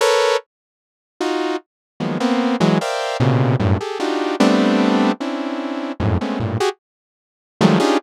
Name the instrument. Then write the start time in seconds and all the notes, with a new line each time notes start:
lead 2 (sawtooth)
0.01 A4 A#4 B4 C#5
1.20 D#4 F4 F#4
2.00 D#3 F3 F#3 G#3 A#3 B3
2.20 A#3 B3 C4
2.60 E3 F#3 G#3
2.81 A#4 C5 D5 E5 F5 G5
3.20 A#2 B2 C3 C#3
3.59 F#2 G2 A2
3.80 G4 G#4 A4
4.00 D4 D#4 F4 F#4 G4
4.40 G3 A3 B3 C4 D4
5.20 C4 C#4 D4 E4
6.00 F2 F#2 G#2 A2
6.21 G#3 A3 B3 C4 C#4
6.40 G2 A2 A#2
6.60 F#4 G4 G#4
7.61 D#3 F3 F#3 G3 G#3 A3
7.80 C#4 D4 D#4 F4 G4 G#4